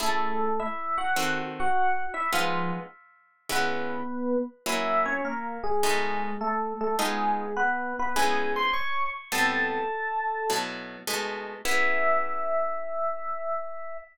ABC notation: X:1
M:4/4
L:1/8
Q:"Swing" 1/4=103
K:E
V:1 name="Electric Piano 1"
[A,A]2 [Ee] [Ff]2 [Ff]2 [Ee] | [^E,^E] z3 [B,B]3 z | [Ee] [Cc] [^A,^A] [G,G]3 [=A,=A] [A,A] | [G,G]2 [B,B] [B,B] [Gg] [=c^b] [^cc'] z |
[Aa]5 z3 | e8 |]
V:2 name="Acoustic Guitar (steel)"
[A,CEG]4 [D,=CFA]4 | [G,B,D^E]4 [C,G,B,=E]4 | [F,^A,CE]4 [B,,G,=A,D]4 | [G,B,D^E]4 [C,G,B,=E]4 |
[A,,=G,B,=C]4 [B,,F,A,E]2 [B,,^G,A,D]2 | [E,B,CG]8 |]